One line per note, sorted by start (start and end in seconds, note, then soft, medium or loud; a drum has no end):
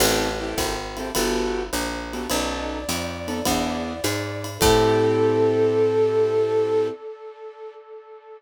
0.00 0.55 A1 medium
0.00 0.28 C4 medium
0.00 0.28 E4 medium
0.00 0.28 G4 medium
0.00 0.28 A4 medium
0.00 crash loud
0.00 ride loud
0.40 0.74 C4 medium
0.40 0.74 E4 medium
0.40 0.74 G4 medium
0.40 0.74 A4 medium
0.58 1.12 G#1 medium
0.58 kick medium
0.58 hi-hat pedal loud
0.58 ride loud
0.97 1.10 C4 medium
0.97 1.10 E4 medium
0.97 1.10 G4 medium
0.97 1.10 A4 medium
0.97 ride medium
1.15 1.70 G1 medium
1.15 1.63 B3 medium
1.15 1.63 F#4 medium
1.15 1.63 G4 medium
1.15 1.63 A4 medium
1.15 ride loud
1.73 2.27 A#1 medium
1.73 hi-hat pedal loud
1.73 ride medium
2.13 2.26 B3 medium
2.13 2.26 F#4 medium
2.13 2.26 G4 medium
2.13 2.26 A4 medium
2.13 ride medium
2.30 2.85 B1 medium
2.30 2.78 B3 medium
2.30 2.78 C#4 medium
2.30 2.78 D#4 medium
2.30 2.78 A4 medium
2.30 4.47 D5 medium
2.30 ride loud
2.89 3.43 F2 medium
2.89 hi-hat pedal loud
2.89 ride loud
3.28 3.40 B3 medium
3.28 3.40 C#4 medium
3.28 3.40 D#4 medium
3.28 3.40 A4 medium
3.28 ride medium
3.45 4.01 E2 medium
3.45 3.93 B3 medium
3.45 3.93 D4 medium
3.45 3.93 E4 medium
3.45 3.93 G#4 medium
3.45 kick medium
3.45 ride loud
4.04 4.58 G#2 medium
4.04 hi-hat pedal loud
4.04 ride loud
4.44 ride medium
4.59 6.90 A2 loud
4.59 6.90 C4 loud
4.59 6.90 E4 loud
4.59 6.90 G4 loud
4.59 6.88 A4 loud
4.59 6.90 A4 loud
4.59 kick loud
4.59 crash loud